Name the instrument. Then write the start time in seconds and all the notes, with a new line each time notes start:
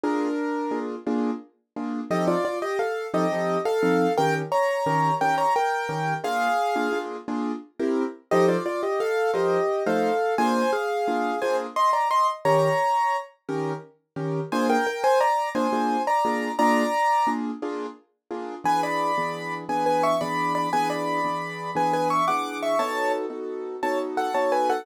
acoustic grand piano
0.03 A#3 D4 F4 G#4 A#4
0.71 A#3 D4 F4 G#4
1.07 A#3 D4 F4 G#4
1.76 A#3 D4 F4 G#4
2.10 F3 C4 D#4 G4 A4 D#5
2.28 F4 D5
2.45 F4 D5
2.62 G4 D#5
2.79 A4 F5
3.14 F3 C4 D#4 G4 A4 D#5
3.32 F3 C4 D#4 A4
3.65 A4 F5
3.83 F3 C4 D#4 A4
4.17 D#3 C#4 G4 A#4 G5
4.52 C#5 A#5
4.86 D#3 C#4 G4 A#4
5.21 D#3 C#4 G4 A#4 G5
5.38 C#5 A#5
5.56 A#4 G5
5.89 D#3 C#4 G4 A#4
6.24 A#3 D4 F4 G#4 F5
6.76 A#3 D4 F4 G#4
6.93 A#3 D4 F4 G#4
7.28 A#3 D4 F4 G#4
7.79 C4 E4 G4 A#4
8.31 F3 D#4 G4 A4 C5 D#5
8.48 F4 D5
8.66 F4 D5
8.83 G4 D#5
9.00 A4 F5
9.33 F3 D#4 G4 A#4 C5 D#5
9.86 F3 A3 D#4 A4 C5 F5
10.38 A#3 D4 F4 G#4 C5 G#5
10.73 G#4 F5
11.08 A#3 D4 F4 G#4
11.42 A#3 D4 F4 G#4 C5 G#5
11.76 D#5 C6
11.93 D5 A#5
12.11 D#5 C6
12.45 D#3 C#4 G4 A#4 C#5 A#5
13.49 D#3 C#4 G4 A#4
14.16 D#3 C#4 G4 A#4
14.52 A#3 D4 F4 G#4 C5 G#5
14.70 A#4 G5
14.87 A#4 G5
15.04 C5 G#5
15.20 D5 A#5
15.55 A#3 D4 F4 G#4 C5 G#5
15.73 A#3 D4 F4 G#4
16.07 D5 A#5
16.25 A#3 D4 F4 G#4
16.59 A#3 D4 F4 G#4 D5 A#5
17.27 A#3 D4 F4 G#4
17.62 A#3 D4 F4 G#4
18.31 A#3 D4 F4 G#4
18.64 E3 B3 D4 G#4 B4 G#5
18.83 D5 B5
19.18 E3 B3 D4 G#4
19.69 E3 B3 D4 G#4 B4 G#5
19.86 B4 G#5
20.03 E5 C#6
20.21 E3 B3 D4 G#4 D5 B5
20.55 D5 B5
20.73 E3 B3 D4 G#4 B4 G#5
20.90 D5 B5
21.24 E3 B3 D4 G#4
21.75 E3 B3 D4 G#4 B4 G#5
21.93 B4 G#5
22.10 E5 C#6
22.28 E3 B3 D4 G#4 F#5 D6
22.63 E5 C#6
22.79 B3 D#4 F#4 A4 C#5 A5
23.30 B3 D#4 F#4 A4
23.83 B3 D#4 F#4 A4 C#5 A5
24.17 A4 F#5
24.34 B3 D#4 F#4 A4 C#5 A5
24.52 B4 G#5
24.70 A4 F#5